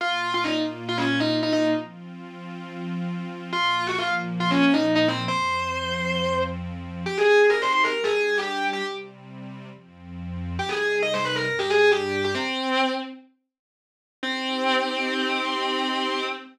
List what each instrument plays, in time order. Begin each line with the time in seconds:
0.00 pad 2 (warm) A#2 A#3 F4, distortion guitar F4
0.34 distortion guitar F4
0.44 distortion guitar D#4
0.89 distortion guitar F4
0.98 distortion guitar C#4
1.20 distortion guitar D#4
1.43 distortion guitar D#4
1.53 distortion guitar D#4
1.76 pad 2 (warm) F3 C4 F4
3.53 pad 2 (warm) A#2 F3 A#3, distortion guitar F4
3.87 distortion guitar F#4
3.98 distortion guitar F4
4.40 distortion guitar F4
4.51 distortion guitar C#4
4.74 distortion guitar D#4
4.95 distortion guitar D#4
5.08 distortion guitar C4
5.28 pad 2 (warm) F2 F3 C4, distortion guitar C5
7.06 pad 2 (warm) C4 D#4 G4, distortion guitar G4
7.18 distortion guitar G#4
7.50 distortion guitar A#4
7.62 distortion guitar C5
7.73 distortion guitar C5
7.84 distortion guitar A#4
7.94 pad 2 (warm) G3 D4 G4
8.04 distortion guitar G#4
8.16 distortion guitar G#4
8.38 distortion guitar G4
8.73 distortion guitar G4
8.82 pad 2 (warm) C3 G3 C4
9.71 pad 2 (warm) F2 F3 C4
10.59 pad 2 (warm) C3 G3 D#4, distortion guitar G4
10.69 distortion guitar G#4
11.02 distortion guitar D#5
11.14 distortion guitar C5
11.25 distortion guitar B4
11.36 distortion guitar A#4
11.47 pad 2 (warm) G2 G3 D4
11.59 distortion guitar G4
11.70 distortion guitar G#4
11.92 distortion guitar G4
12.24 distortion guitar G4
12.35 distortion guitar C4
14.23 distortion guitar C4, pad 2 (warm) C4 D#4 G4